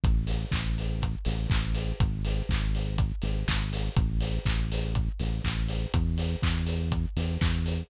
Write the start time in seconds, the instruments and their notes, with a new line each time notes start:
0.04 synth bass 1 A1, kick, closed hi-hat
0.27 open hi-hat
0.52 synth bass 1 A1, kick, clap
0.78 open hi-hat
1.02 kick, closed hi-hat
1.25 synth bass 1 A1, open hi-hat
1.50 synth bass 1 A1, kick, clap
1.75 open hi-hat
2.00 synth bass 1 G#1, kick, closed hi-hat
2.25 open hi-hat
2.49 synth bass 1 G#1, kick, clap
2.75 open hi-hat
2.98 kick, closed hi-hat
3.22 synth bass 1 G#1, open hi-hat
3.48 synth bass 1 G#1, kick, clap
3.73 open hi-hat
3.96 synth bass 1 A1, kick, closed hi-hat
4.21 open hi-hat
4.45 synth bass 1 A1, kick, clap
4.72 open hi-hat
4.95 kick, closed hi-hat
5.20 synth bass 1 A1, open hi-hat
5.44 synth bass 1 A1, kick, clap
5.68 open hi-hat
5.94 synth bass 1 E2, kick, closed hi-hat
6.18 open hi-hat
6.43 synth bass 1 E2, kick, clap
6.66 open hi-hat
6.92 kick, closed hi-hat
7.16 synth bass 1 E2, open hi-hat
7.41 synth bass 1 E2, kick, clap
7.66 open hi-hat